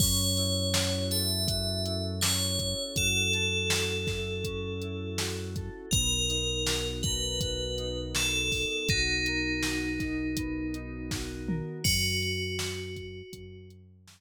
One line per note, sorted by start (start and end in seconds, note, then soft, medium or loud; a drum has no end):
0.00 2.74 F#2 medium
0.00 2.22 C#4 loud
0.00 1.07 C#5 medium
0.00 kick loud
0.00 crash loud
0.37 1.84 E4 medium
0.37 closed hi-hat medium
0.74 1.47 F#4 medium
0.74 snare loud
1.11 3.32 A4 medium
1.11 2.02 E5 medium
1.11 snare medium
1.11 closed hi-hat loud
1.47 2.96 F#4 medium
1.47 kick loud
1.47 closed hi-hat loud
1.85 2.58 E4 medium
1.85 closed hi-hat loud
2.21 4.44 C#4 medium
2.21 2.84 C#5 medium
2.21 snare loud
2.59 4.07 E4 medium
2.59 kick loud
2.59 closed hi-hat medium
2.96 5.70 F#2 medium
2.96 3.70 F#4 medium
2.96 5.41 A4 medium
2.96 kick loud
2.96 closed hi-hat loud
3.33 5.55 A4 medium
3.33 closed hi-hat medium
3.70 5.18 F#4 medium
3.70 snare loud
4.07 4.82 E4 medium
4.07 kick loud
4.07 snare medium
4.44 5.86 C#4 medium
4.44 kick loud
4.44 closed hi-hat loud
4.82 5.89 E4 medium
4.82 closed hi-hat medium
5.18 5.89 F#4 medium
5.18 snare loud
5.56 5.91 A4 medium
5.56 kick loud
5.56 closed hi-hat medium
5.91 8.66 B1 loud
5.91 8.14 B3 medium
5.91 6.88 A#4 medium
5.91 kick loud
5.91 closed hi-hat loud
6.29 7.77 D#4 medium
6.29 closed hi-hat loud
6.67 7.40 F#4 medium
6.67 snare loud
7.03 9.26 A#4 medium
7.03 7.98 B4 medium
7.03 kick loud
7.03 closed hi-hat medium
7.41 8.90 F#4 medium
7.41 kick loud
7.41 closed hi-hat loud
7.78 8.50 D#4 medium
7.78 closed hi-hat medium
8.14 10.37 B3 medium
8.14 8.87 A4 medium
8.14 snare loud
8.51 9.99 D#4 medium
8.51 kick medium
8.51 open hi-hat medium
8.88 11.62 B1 medium
8.88 11.55 D#4 medium
8.88 9.63 F#4 medium
8.88 kick loud
8.88 closed hi-hat loud
9.26 11.47 A#4 medium
9.26 closed hi-hat medium
9.63 11.11 F#4 medium
9.63 snare loud
10.00 10.74 D#4 medium
10.00 kick medium
10.00 snare soft
10.00 closed hi-hat medium
10.37 11.79 B3 medium
10.37 kick medium
10.37 closed hi-hat loud
10.74 11.80 D#4 medium
10.74 closed hi-hat medium
11.11 11.83 F#4 medium
11.11 kick loud
11.11 snare loud
11.47 11.83 A#4 medium
11.47 mid tom loud
11.84 13.23 F#2 medium
11.84 13.64 F#4 medium
11.84 kick loud
11.84 crash loud
12.22 closed hi-hat medium
12.59 snare loud
12.96 kick loud
12.96 closed hi-hat medium
13.33 14.21 F#2 medium
13.33 kick loud
13.33 closed hi-hat loud
13.70 closed hi-hat medium
14.08 snare loud